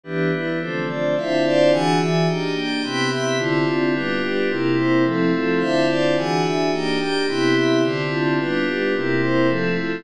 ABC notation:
X:1
M:2/2
L:1/8
Q:1/2=108
K:Ddor
V:1 name="Pad 5 (bowed)"
[E,G,B,D]4 [D,F,A,C]4 | [D,CEF]4 [E,D^F^G]4 | [_B,D_EG]4 [C,=B,=EG]4 | [D,CEF]4 [G,B,DF]4 |
[C,G,_B,E]4 [F,A,CE]4 | [D,CEF]4 [E,D^F^G]4 | [_B,D_EG]4 [C,=B,=EG]4 | [D,CEF]4 [G,B,DF]4 |
[C,G,_B,E]4 [F,A,CE]4 |]
V:2 name="Pad 5 (bowed)"
[E,DGB]2 [E,DEB]2 [DFAc]2 [DFcd]2 | [Dcef]2 [Dcdf]2 [E,D^f^g]2 [E,Deg]2 | [_B,D_Eg]2 [B,DGg]2 [C=Eg=b]2 [CEeb]2 | [D,CEF]2 [D,CDF]2 [G,DFB]2 [G,DGB]2 |
[CEG_B]2 [CEBc]2 [F,CEA]2 [F,CFA]2 | [Dcef]2 [Dcdf]2 [E,D^f^g]2 [E,Deg]2 | [_B,D_Eg]2 [B,DGg]2 [C=Eg=b]2 [CEeb]2 | [D,CEF]2 [D,CDF]2 [G,DFB]2 [G,DGB]2 |
[CEG_B]2 [CEBc]2 [F,CEA]2 [F,CFA]2 |]